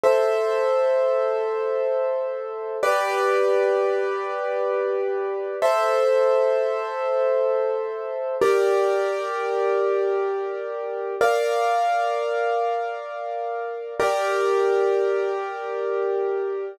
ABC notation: X:1
M:6/8
L:1/8
Q:3/8=86
K:G
V:1 name="Acoustic Grand Piano"
[Ace]6- | [Ace]6 | [GBd]6- | [GBd]6 |
[Ace]6- | [Ace]6 | [K:Gm] [GBd]6- | [GBd]6 |
[Bdf]6- | [Bdf]6 | [GBd]6- | [GBd]6 |]